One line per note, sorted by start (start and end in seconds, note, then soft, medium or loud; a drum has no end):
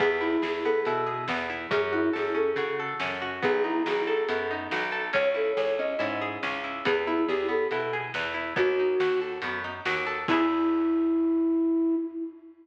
0.00 0.37 E2 medium
0.00 0.65 B3 medium
0.00 0.10 G#4 loud
0.00 kick medium
0.00 crash medium
0.11 0.21 G#4 medium
0.21 0.86 E4 medium
0.21 0.42 E4 medium
0.42 0.81 E2 medium
0.42 0.63 G#4 medium
0.42 1.06 G#4 medium
0.42 snare loud
0.64 1.29 B3 medium
0.64 0.83 A4 medium
0.85 1.25 B2 medium
0.85 1.49 E4 medium
0.85 closed hi-hat medium
1.06 1.67 G#4 medium
1.28 1.67 E2 medium
1.28 1.70 B3 medium
1.28 snare loud
1.50 1.70 E4 medium
1.71 2.09 F#2 medium
1.71 2.34 C#4 loud
1.71 1.82 G#4 medium
1.71 kick loud
1.71 closed hi-hat loud
1.82 1.93 G#4 medium
1.93 2.11 E4 medium
1.93 2.57 F#4 medium
2.13 2.54 F#2 medium
2.13 2.35 G#4 medium
2.13 2.79 A4 medium
2.13 snare medium
2.35 3.00 C#4 medium
2.35 2.53 A4 medium
2.56 2.94 C#3 medium
2.56 3.21 F#4 medium
2.56 closed hi-hat medium
2.80 3.41 A4 medium
3.00 3.40 F#2 medium
3.00 3.41 C#4 medium
3.00 snare loud
3.22 3.42 F#4 medium
3.42 3.83 B1 medium
3.42 4.28 B3 loud
3.42 3.53 G#4 medium
3.42 kick loud
3.42 closed hi-hat medium
3.53 3.63 G#4 medium
3.64 4.50 D#4 medium
3.64 3.83 E4 medium
3.86 4.25 B1 medium
3.86 4.72 F#4 medium
3.86 4.06 G#4 medium
3.86 snare loud
4.07 4.27 A4 medium
4.07 4.92 A4 medium
4.29 4.68 F#2 medium
4.29 5.10 B3 medium
4.29 closed hi-hat loud
4.51 5.12 D#4 medium
4.71 5.10 B1 medium
4.71 5.13 F#4 medium
4.71 snare loud
4.92 5.12 A4 medium
5.13 5.53 C#2 medium
5.13 5.79 C#4 loud
5.13 5.24 C#5 medium
5.13 kick medium
5.13 closed hi-hat medium
5.25 5.35 C#5 medium
5.34 5.98 E4 medium
5.34 5.53 A4 medium
5.57 5.95 C#2 medium
5.57 6.21 G#4 medium
5.57 5.74 C#5 medium
5.57 snare loud
5.79 6.43 C#4 medium
5.79 5.97 D#5 medium
5.99 6.38 G#2 medium
5.99 6.63 E4 medium
5.99 closed hi-hat medium
6.22 6.83 G#4 medium
6.43 6.82 C#2 medium
6.43 6.84 C#4 medium
6.43 snare medium
6.64 6.84 E4 medium
6.85 7.25 E2 medium
6.85 7.05 B3 medium
6.85 6.95 G#4 medium
6.85 kick loud
6.85 closed hi-hat loud
6.96 7.06 G#4 medium
7.07 7.25 E4 medium
7.07 7.27 E4 medium
7.28 7.67 E2 medium
7.28 7.47 G4 medium
7.28 7.49 G#4 medium
7.28 snare medium
7.49 7.68 B3 medium
7.49 7.69 A4 medium
7.71 8.10 B2 medium
7.71 7.91 E4 medium
7.71 closed hi-hat medium
7.93 8.13 G#4 medium
8.14 8.53 E2 medium
8.14 8.34 B3 medium
8.14 snare loud
8.34 8.54 E4 medium
8.56 8.95 D#2 medium
8.56 8.75 B3 loud
8.56 9.20 F#4 medium
8.56 kick loud
8.56 closed hi-hat medium
8.79 8.99 D#4 medium
9.00 9.38 D#2 medium
9.00 9.20 F#4 medium
9.00 snare loud
9.21 9.41 A4 medium
9.42 9.81 F#2 medium
9.42 9.63 B3 medium
9.42 closed hi-hat loud
9.64 9.83 D#4 medium
9.85 10.25 D#2 medium
9.85 10.05 F#4 medium
9.85 snare loud
10.07 10.26 A4 medium
10.28 11.96 E2 loud
10.28 11.97 B3 loud
10.28 11.95 E4 loud
10.28 11.97 E4 loud
10.28 kick loud
10.28 crash loud
10.33 11.97 G#4 loud